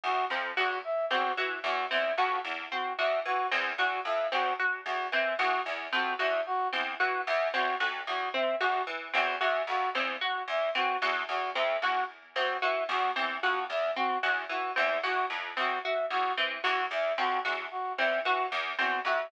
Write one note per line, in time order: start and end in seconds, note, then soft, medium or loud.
0.04 0.25 E2 medium
0.04 0.25 F#4 medium
0.30 0.52 F2 medium
0.30 0.52 C4 medium
0.57 0.79 E2 medium
0.57 0.78 F#4 medium
0.84 1.06 E5 medium
1.10 1.32 E2 medium
1.10 1.32 C4 medium
1.10 1.32 F#4 medium
1.37 1.59 E3 medium
1.37 1.59 F#4 medium
1.64 1.85 E2 medium
1.64 1.85 F#4 medium
1.91 2.13 E2 medium
1.91 2.12 C4 medium
1.91 2.12 E5 medium
2.17 2.39 F2 medium
2.17 2.39 F#4 medium
2.44 2.66 E2 medium
2.71 2.93 C4 medium
2.71 2.93 F#4 medium
2.98 3.20 E2 medium
2.98 3.20 F#4 medium
2.98 3.19 E5 medium
3.25 3.47 E3 medium
3.25 3.47 F#4 medium
3.51 3.73 E2 medium
3.51 3.73 C4 medium
3.78 4.00 E2 medium
3.78 4.00 F#4 medium
4.05 4.26 F2 medium
4.05 4.27 E5 medium
4.32 4.54 E2 medium
4.32 4.53 C4 medium
4.32 4.53 F#4 medium
4.59 4.81 F#4 medium
4.85 5.07 E2 medium
4.85 5.07 F#4 medium
5.12 5.34 E3 medium
5.12 5.34 C4 medium
5.12 5.34 E5 medium
5.39 5.60 E2 medium
5.39 5.60 F#4 medium
5.39 5.61 F#4 medium
5.66 5.87 E2 medium
5.92 6.14 F2 medium
5.92 6.14 C4 medium
5.92 6.14 F#4 medium
6.19 6.41 E2 medium
6.19 6.40 F#4 medium
6.19 6.41 E5 medium
6.46 6.68 F#4 medium
6.73 6.95 E2 medium
6.73 6.94 C4 medium
7.00 7.22 E3 medium
7.00 7.21 F#4 medium
7.26 7.49 E2 medium
7.26 7.48 E5 medium
7.54 7.75 E2 medium
7.54 7.75 C4 medium
7.54 7.75 F#4 medium
7.80 8.02 F2 medium
7.80 8.02 F#4 medium
8.07 8.29 E2 medium
8.07 8.29 F#4 medium
8.34 8.55 C4 medium
8.34 8.56 E5 medium
8.60 8.82 E2 medium
8.60 8.82 F#4 medium
8.87 9.08 E3 medium
9.13 9.36 E2 medium
9.13 9.35 C4 medium
9.13 9.35 F#4 medium
9.41 9.62 E2 medium
9.41 9.62 F#4 medium
9.41 9.62 E5 medium
9.67 9.89 F2 medium
9.67 9.89 F#4 medium
9.95 10.16 E2 medium
9.95 10.17 C4 medium
10.21 10.43 F#4 medium
10.48 10.69 E2 medium
10.48 10.70 E5 medium
10.75 10.96 E3 medium
10.75 10.96 C4 medium
10.75 10.97 F#4 medium
11.02 11.23 E2 medium
11.02 11.24 F#4 medium
11.29 11.50 E2 medium
11.29 11.50 F#4 medium
11.55 11.77 F2 medium
11.55 11.77 C4 medium
11.55 11.77 E5 medium
11.82 12.03 E2 medium
11.82 12.04 F#4 medium
11.82 12.05 F#4 medium
12.36 12.57 E2 medium
12.36 12.57 C4 medium
12.36 12.57 F#4 medium
12.62 12.84 E3 medium
12.62 12.83 F#4 medium
12.62 12.83 E5 medium
12.89 13.10 E2 medium
12.89 13.11 F#4 medium
13.16 13.37 E2 medium
13.16 13.37 C4 medium
13.43 13.65 F2 medium
13.43 13.64 F#4 medium
13.70 13.91 E2 medium
13.70 13.91 E5 medium
13.96 14.18 C4 medium
13.96 14.18 F#4 medium
14.23 14.45 E2 medium
14.23 14.44 F#4 medium
14.49 14.71 E3 medium
14.49 14.72 F#4 medium
14.76 14.99 E2 medium
14.76 14.97 C4 medium
14.76 14.98 E5 medium
15.03 15.25 E2 medium
15.03 15.25 F#4 medium
15.30 15.51 F2 medium
15.57 15.79 E2 medium
15.57 15.78 C4 medium
15.57 15.79 F#4 medium
15.84 16.06 F#4 medium
15.84 16.05 E5 medium
16.10 16.32 E2 medium
16.10 16.32 F#4 medium
16.37 16.59 E3 medium
16.37 16.59 C4 medium
16.64 16.86 E2 medium
16.64 16.85 F#4 medium
16.64 16.86 F#4 medium
16.91 17.12 E2 medium
16.91 17.13 E5 medium
17.18 17.39 F2 medium
17.18 17.39 C4 medium
17.18 17.40 F#4 medium
17.45 17.67 E2 medium
17.45 17.66 F#4 medium
17.71 17.92 F#4 medium
17.98 18.20 E2 medium
17.98 18.20 C4 medium
17.98 18.20 E5 medium
18.25 18.47 E3 medium
18.25 18.46 F#4 medium
18.25 18.47 F#4 medium
18.52 18.73 E2 medium
18.78 19.00 E2 medium
18.78 19.00 C4 medium
18.78 19.00 F#4 medium
19.05 19.26 F2 medium
19.05 19.27 F#4 medium
19.05 19.27 E5 medium